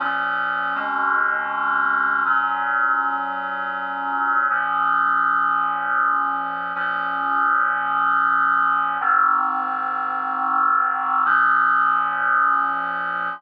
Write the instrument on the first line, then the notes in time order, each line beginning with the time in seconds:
clarinet
0.00 A#2 F3 C#4
0.75 F2 B2 G#3 C#4
2.25 A#2 F#3 C#4
4.50 A#2 F3 C#4
6.75 A#2 F3 C#4
9.00 G#2 D#3 C4
11.25 A#2 F3 C#4